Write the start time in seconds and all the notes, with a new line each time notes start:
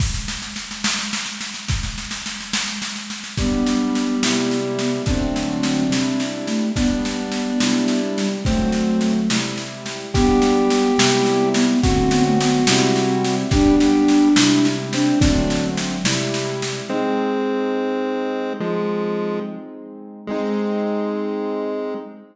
0.00 kick, snare, crash
0.14 snare
0.28 snare
0.42 snare
0.56 snare
0.71 snare
0.84 snare
0.99 snare
1.13 snare
1.26 snare
1.41 snare
1.54 snare
1.68 kick, snare
1.83 snare
1.98 snare
2.11 snare
2.26 snare
2.40 snare
2.53 snare
2.68 snare
2.82 snare
2.96 snare
3.10 snare
3.24 snare
3.38 G3 B3 D4, kick, snare
3.66 snare
3.95 snare
4.23 C3 G3 E4, snare
4.51 snare
4.79 B3, snare
5.06 D3 F#3 A3 C4 D4, kick, snare
5.11 C4
5.36 snare
5.63 snare
5.90 C3 G3 E4, snare
6.20 snare
6.47 A3, snare
6.76 G3 B3 D4, kick, snare
7.05 snare
7.32 snare
7.60 C3 G3 E4, snare
7.88 snare
8.17 G3, snare
8.45 D3 F#3 A3 C4, kick, snare
8.72 snare
9.01 snare
9.30 C3 G3 E4, snare
9.57 snare
9.86 snare
10.14 G3 B3 D4 G4, kick, snare
10.42 snare
10.70 snare
10.98 C3 G3 E4, snare
11.26 snare
11.54 B3, snare
11.83 D3 F#3 A3 C4 F#4, kick, snare
11.87 C4
12.11 B3, snare
12.26 A3
12.40 B3, snare
12.67 C3 G3 C4 E4, snare
12.96 C4, snare
13.25 snare
13.51 G3 D4 G4, kick, snare
13.55 B3 D4
13.80 G4, snare
14.08 snare
14.36 C3 G3 E4, snare
14.65 snare
14.93 C4 D4, snare
15.20 D3 F#3 A3 C4 D4, kick, snare
15.50 snare
15.77 snare
16.04 C3 G3 E4, snare
16.34 snare
16.62 snare
16.89 G#3 C4 D#4
18.60 F3 G#3
20.27 G#3 C4 D#4